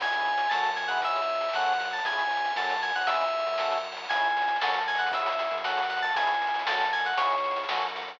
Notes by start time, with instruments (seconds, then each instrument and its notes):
0.00 synth bass 1 C#2, drawbar organ C#4 E4 G#4 C#5 E5 G#5, electric piano 2 G#5, kick, closed hi-hat
0.06 closed hi-hat
0.12 drawbar organ C#4 E4 G#4, closed hi-hat
0.20 closed hi-hat
0.25 closed hi-hat
0.32 closed hi-hat
0.38 closed hi-hat
0.45 closed hi-hat
0.49 synth bass 1 F#2, drawbar organ F#4 A4 C#5 F#5 A5, electric piano 2 A5, snare
0.54 drawbar organ C#4, closed hi-hat
0.64 closed hi-hat
0.71 closed hi-hat
0.76 electric piano 2 G#5, closed hi-hat
0.83 closed hi-hat
0.88 drawbar organ C#4 E4 G#4, electric piano 2 F#5, closed hi-hat
0.97 closed hi-hat
1.01 synth bass 1 C#2, drawbar organ C#5 E5 G#5, electric piano 2 E5, kick, closed hi-hat
1.09 closed hi-hat
1.16 closed hi-hat
1.22 closed hi-hat
1.28 closed hi-hat
1.35 closed hi-hat
1.41 closed hi-hat
1.49 closed hi-hat
1.53 synth bass 1 F#2, drawbar organ C#4 F#4 A4 C#5 F#5 A5, electric piano 2 F#5, snare
1.60 closed hi-hat
1.66 closed hi-hat
1.72 closed hi-hat
1.78 electric piano 2 F#5, closed hi-hat
1.85 closed hi-hat
1.91 electric piano 2 A5, closed hi-hat
1.98 closed hi-hat
2.05 synth bass 1 C#2, drawbar organ C#4 E4 G#4 C#5 E5 G#5, electric piano 2 G#5, kick, closed hi-hat
2.12 closed hi-hat
2.18 closed hi-hat
2.25 closed hi-hat
2.30 closed hi-hat
2.37 closed hi-hat
2.45 closed hi-hat
2.50 closed hi-hat
2.56 synth bass 1 F#2, drawbar organ C#4 F#4 A4 C#5 F#5 A5, electric piano 2 A5, snare
2.63 closed hi-hat
2.70 closed hi-hat
2.76 closed hi-hat
2.82 electric piano 2 G#5, closed hi-hat
2.89 closed hi-hat
2.95 synth bass 1 C#2, electric piano 2 F#5, closed hi-hat
3.01 closed hi-hat
3.07 drawbar organ C#4 E4 G#4 C#5 E5 G#5, electric piano 2 E5, kick, closed hi-hat
3.14 closed hi-hat
3.21 closed hi-hat
3.27 closed hi-hat
3.33 closed hi-hat
3.39 closed hi-hat
3.46 synth bass 1 F#2, closed hi-hat
3.53 closed hi-hat
3.58 drawbar organ C#4 F#4 A4 C#5 F#5 A5, snare
3.65 closed hi-hat
3.71 closed hi-hat
3.78 closed hi-hat
3.84 closed hi-hat
3.92 closed hi-hat
3.97 closed hi-hat
4.04 open hi-hat
4.09 synth bass 1 C#2, drawbar organ C#4 E4 G#4, electric piano 2 G#5, kick, closed hi-hat
4.16 closed hi-hat
4.24 closed hi-hat
4.30 closed hi-hat
4.37 closed hi-hat
4.42 closed hi-hat
4.48 closed hi-hat
4.56 closed hi-hat
4.61 synth bass 1 F#2, drawbar organ C#4 F#4 A4, electric piano 2 A5, snare
4.68 closed hi-hat
4.74 closed hi-hat
4.80 closed hi-hat
4.87 electric piano 2 G#5, closed hi-hat
4.95 electric piano 2 F#5, closed hi-hat
4.99 closed hi-hat
5.07 closed hi-hat
5.12 synth bass 1 C#2, drawbar organ C#4 E4 G#4, electric piano 2 E5, kick, closed hi-hat
5.19 closed hi-hat
5.26 closed hi-hat
5.32 closed hi-hat
5.39 closed hi-hat
5.46 closed hi-hat
5.51 synth bass 1 F#2, closed hi-hat
5.58 closed hi-hat
5.63 drawbar organ C#4 F#4 A4, electric piano 2 F#5, snare
5.70 closed hi-hat
5.77 closed hi-hat
5.83 closed hi-hat
5.90 electric piano 2 F#5, closed hi-hat
5.97 closed hi-hat
6.02 electric piano 2 A5, closed hi-hat
6.09 open hi-hat
6.14 synth bass 1 C#2, drawbar organ C#4 E4 G#4, electric piano 2 G#5, kick, closed hi-hat
6.22 closed hi-hat
6.27 closed hi-hat
6.34 closed hi-hat
6.42 closed hi-hat
6.47 closed hi-hat
6.54 closed hi-hat
6.59 closed hi-hat
6.66 synth bass 1 F#2, drawbar organ C#4 F#4 A4, electric piano 2 A5, snare
6.73 closed hi-hat
6.81 closed hi-hat
6.85 closed hi-hat
6.93 electric piano 2 G#5, closed hi-hat
6.98 closed hi-hat
7.05 electric piano 2 F#5, closed hi-hat
7.13 closed hi-hat
7.17 synth bass 1 C#2, drawbar organ C#4 E4 G#4, electric piano 2 C#5, kick, closed hi-hat
7.26 closed hi-hat
7.30 closed hi-hat
7.38 closed hi-hat
7.44 closed hi-hat
7.51 closed hi-hat
7.56 closed hi-hat
7.64 closed hi-hat
7.69 synth bass 1 F#2, drawbar organ C#4 F#4 A4, snare
7.76 closed hi-hat
7.81 closed hi-hat
7.89 closed hi-hat
7.96 closed hi-hat
8.02 closed hi-hat
8.08 closed hi-hat
8.14 closed hi-hat